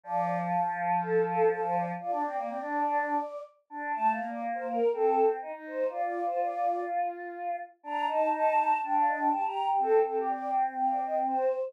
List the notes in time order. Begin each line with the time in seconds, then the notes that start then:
0.04 F3 D5
1.01 A4
1.26 A4
1.49 A4
1.63 C5
1.74 D5
2.00 F4 D5
2.11 D4
2.24 C4
2.38 A#3
2.48 C4
2.60 D4
2.84 D4
3.70 D4
3.94 A3 A5
4.10 F5
4.18 A#3
4.27 D5
4.55 C5
4.67 A#4
4.93 C4 A4
5.42 D#4
5.52 D#4
5.66 C5
5.89 F4 D5
6.02 D5
6.26 C5
6.38 D5
7.83 D4 A#5
8.07 D#4 A5
8.33 A5
8.82 D4 G5
8.93 F5
9.07 D#5
9.19 G5
9.31 G4 A5
9.43 G4 A#5
9.79 C4 A4
10.04 C4 A4
10.16 G4
10.28 D5
10.77 F5
10.89 D5
11.03 D#5
11.26 C5